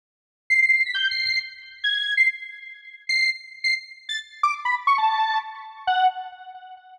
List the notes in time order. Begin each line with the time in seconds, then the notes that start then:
0.50 C7
0.62 C7
0.73 C7
0.85 B6
0.94 G6
1.11 C7
1.25 C7
1.84 G#6
2.17 C7
3.09 C7
3.64 C7
4.09 A6
4.43 D6
4.65 B5
4.87 C#6
4.98 A5
5.87 F#5